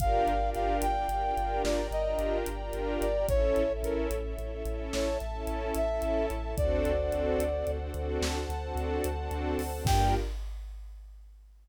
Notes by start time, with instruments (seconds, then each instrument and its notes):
0.00 synth bass 2 G1, string ensemble 1 D4 F4 G4 A#4 D5 F5 G5, brass section F5, kick, closed hi-hat
0.27 synth bass 2 G1, closed hi-hat
0.40 string ensemble 1 D4 F4 G4 A#4
0.55 synth bass 2 G1, brass section F5, closed hi-hat
0.82 synth bass 2 G1, brass section G5, closed hi-hat
0.96 string ensemble 1 D4 F4 G4 A#4
1.08 synth bass 2 G1, string ensemble 1 D4 F4 G4 A#4, closed hi-hat
1.23 string ensemble 1 D4 F4 G4 A#4
1.37 synth bass 2 G1, string ensemble 1 D4 F4 G4 A#4, closed hi-hat
1.64 synth bass 2 G1, string ensemble 1 A#4 D5 G5 A#5, brass section D5, snare
1.91 synth bass 2 G1, brass section D#5, closed hi-hat
2.05 string ensemble 1 D4 F4 G4 A#4
2.19 synth bass 2 G1, closed hi-hat
2.46 synth bass 2 G1, closed hi-hat
2.61 string ensemble 1 D4 F4 G4 A#4
2.73 synth bass 2 G1, closed hi-hat
3.01 synth bass 2 G1, brass section D5, closed hi-hat
3.16 string ensemble 1 D4 F4 G4 A#4
3.28 synth bass 2 A1, string ensemble 1 C#4 E4 A4 C#5 E5, brass section C#5, kick, closed hi-hat
3.56 synth bass 2 A1, closed hi-hat
3.71 string ensemble 1 C#4 E4 A4
3.83 synth bass 2 A1, brass section A#4, closed hi-hat
4.11 synth bass 2 A1, closed hi-hat
4.23 string ensemble 1 C#4 E4 A4
4.38 synth bass 2 A1, string ensemble 1 C#4 E4 A4, closed hi-hat
4.51 string ensemble 1 C#4 E4 A4
4.64 synth bass 2 A1, string ensemble 1 C#4 E4 A4, closed hi-hat
4.93 synth bass 2 A1, string ensemble 1 A4 E5 A5, brass section C#5, snare
5.20 synth bass 2 A1, closed hi-hat
5.33 string ensemble 1 C#4 E4 A4
5.47 synth bass 2 A1, closed hi-hat
5.75 synth bass 2 A1, brass section E5, closed hi-hat
5.90 string ensemble 1 C#4 E4 A4
6.02 synth bass 2 A1, closed hi-hat
6.30 synth bass 2 A1, closed hi-hat
6.43 string ensemble 1 C#4 E4 A4
6.57 synth bass 2 D2, string ensemble 1 C4 D4 F#4 A4 C5 D5 F#5, brass section D5, kick, closed hi-hat
6.85 synth bass 2 D2, closed hi-hat
6.99 string ensemble 1 C4 D4 F#4 A4
7.12 synth bass 2 D2, closed hi-hat
7.38 synth bass 2 D2, closed hi-hat
7.54 string ensemble 1 C4 D4 F#4 A4
7.66 synth bass 2 D2, string ensemble 1 C4 D4 F#4 A4, closed hi-hat
7.80 string ensemble 1 C4 D4 F#4 A4
7.94 synth bass 2 D2, string ensemble 1 C4 D4 F#4 A4, closed hi-hat
8.21 synth bass 2 D2, string ensemble 1 A4 C5 F#5 A5, snare
8.49 synth bass 2 D2, closed hi-hat
8.63 string ensemble 1 C4 D4 F#4 A4
8.75 synth bass 2 D2, closed hi-hat
9.04 synth bass 2 D2, closed hi-hat
9.18 string ensemble 1 C4 D4 F#4 A4
9.31 synth bass 2 D2, closed hi-hat
9.58 synth bass 2 D2, open hi-hat
9.73 string ensemble 1 C4 D4 F#4 A4
9.85 synth bass 2 G2, string ensemble 1 A#3 D4 F4 G4 A#4, brass section G5, kick, crash